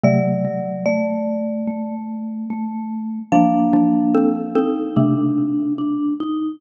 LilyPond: <<
  \new Staff \with { instrumentName = "Marimba" } { \time 4/4 \key g \minor \tempo 4 = 73 d''4 d''4. r4. | f''1 | }
  \new Staff \with { instrumentName = "Xylophone" } { \time 4/4 \key g \minor <c a>2.~ <c a>8 r8 | <f d'>8 <f d'>8 <c' a'>8 <c' a'>8 <c a>2 | }
  \new Staff \with { instrumentName = "Vibraphone" } { \time 4/4 \key g \minor fis8 fis8 a4 a4 a4 | <bes d'>4. ees'8 d'4 d'8 ees'8 | }
>>